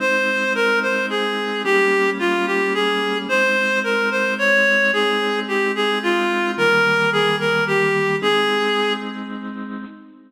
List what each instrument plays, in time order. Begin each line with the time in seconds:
0.00 drawbar organ G#3 C4 D#4, clarinet C5
0.55 clarinet A#4
0.82 clarinet C5
1.10 clarinet G#4
1.64 drawbar organ G3 A#3 C#4, clarinet G4
2.19 clarinet F4
2.47 clarinet G4
2.74 clarinet G#4
3.29 drawbar organ G#3 C4 D#4, clarinet C5
3.84 clarinet A#4
4.11 clarinet C5
4.38 clarinet C#5
4.93 drawbar organ G#3 C4 D#4, clarinet G#4
5.48 clarinet G4
5.75 clarinet G#4
6.03 clarinet F4
6.58 drawbar organ D#3 G3 A#3, clarinet A#4
7.12 clarinet G#4
7.40 clarinet A#4
7.67 clarinet G4
8.22 drawbar organ G#3 C4 D#4, clarinet G#4